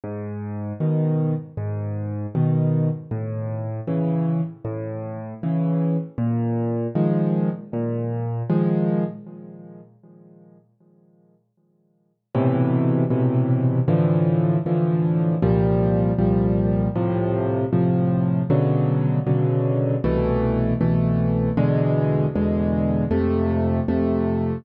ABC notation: X:1
M:4/4
L:1/8
Q:1/4=78
K:G#m
V:1 name="Acoustic Grand Piano"
G,,2 [B,,D,]2 G,,2 [B,,D,]2 | =A,,2 [C,E,]2 A,,2 [C,E,]2 | A,,2 [D,^E,G,]2 A,,2 [D,E,G,]2 | z8 |
[K:Am] [A,,B,,C,E,]2 [A,,B,,C,E,]2 [A,,D,E,F,]2 [A,,D,E,F,]2 | [C,,_B,,F,G,]2 [C,,B,,F,G,]2 [A,,C,F,]2 [A,,C,F,]2 | [B,,^C,D,^F,]2 [B,,C,D,F,]2 [=C,,B,,E,A,]2 [C,,B,,E,A,]2 | [E,,B,,D,^G,]2 [E,,B,,D,G,]2 [F,,C,A,]2 [F,,C,A,]2 |]